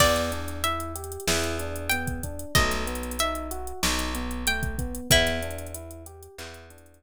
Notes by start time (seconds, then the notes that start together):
0.00 E2 B3 D5, kick, crash
0.16 snare, closed hi-hat
0.32 D4, closed hi-hat
0.48 closed hi-hat
0.64 E4 E5, closed hi-hat
0.80 closed hi-hat
0.95 G4, closed hi-hat
1.04 closed hi-hat
1.12 closed hi-hat
1.20 closed hi-hat
1.28 E2 E4, snare
1.44 closed hi-hat
1.59 D4, closed hi-hat
1.76 closed hi-hat
1.89 B3 G5, closed hi-hat
2.07 kick, closed hi-hat
2.23 D4, kick, closed hi-hat
2.39 closed hi-hat
2.55 B1 A3 D#5, kick, closed hi-hat
2.71 snare, closed hi-hat
2.87 B3, closed hi-hat
2.95 closed hi-hat
3.03 closed hi-hat
3.11 closed hi-hat
3.19 D#4 E5, closed hi-hat
3.35 closed hi-hat
3.51 F#4, closed hi-hat
3.67 closed hi-hat
3.83 B1 D#4, snare
3.99 closed hi-hat
4.15 B3, closed hi-hat
4.31 closed hi-hat
4.47 A3 G5, closed hi-hat
4.63 kick, closed hi-hat
4.78 B3, kick, closed hi-hat
4.95 closed hi-hat
5.11 E2 B3 E4, kick, closed hi-hat
5.27 snare, closed hi-hat
5.42 D4, closed hi-hat
5.51 closed hi-hat
5.59 closed hi-hat
5.66 closed hi-hat
5.74 E4, closed hi-hat
5.91 closed hi-hat
6.06 G4, closed hi-hat
6.23 closed hi-hat
6.38 E2 E4, clap
6.54 closed hi-hat
6.70 D4, closed hi-hat
6.78 closed hi-hat
6.86 closed hi-hat
6.94 closed hi-hat